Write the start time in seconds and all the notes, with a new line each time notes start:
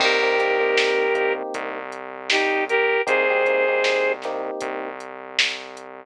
0.00 C2 A#3 C4 D#4 G4 A#4, kick, crash
0.23 A#3 C4 D#4 G4
0.38 A#3 C4 D#4 G4, kick, closed hi-hat
0.60 A#3 C4 D#4 G4
0.77 snare
1.15 A#3 C4 D#4 G4, kick, closed hi-hat
1.54 C2, kick, closed hi-hat
1.92 closed hi-hat
2.30 D#4 G4, snare
2.69 G4 A#4, closed hi-hat
3.07 C2 A#3 C4 D#4 G4 G#4 C5, kick, closed hi-hat
3.30 A#3 C4 D#4 G4
3.45 A#3 C4 D#4 G4, kick, closed hi-hat
3.68 A#3 C4 D#4 G4
3.84 snare
4.22 A#3 C4 D#4 G4, snare, closed hi-hat
4.61 C2, kick, closed hi-hat
5.00 closed hi-hat
5.39 snare
5.77 closed hi-hat